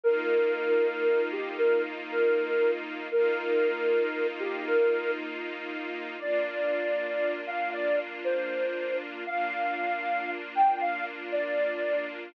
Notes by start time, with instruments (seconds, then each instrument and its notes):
0.04 string ensemble 1 A#3 D#4 F4, ocarina A#4
1.32 ocarina G4
1.58 ocarina A#4
2.09 ocarina A#4
3.11 string ensemble 1 A#3 D#4 F4, ocarina A#4
4.40 ocarina G4
4.66 ocarina A#4
6.19 string ensemble 1 A#3 D4 F4, ocarina D5
7.47 ocarina F5
7.73 ocarina D5
8.24 ocarina C5
9.26 string ensemble 1 A#3 D4 F4, ocarina F5
10.55 ocarina G5
10.81 ocarina F5
11.32 ocarina D5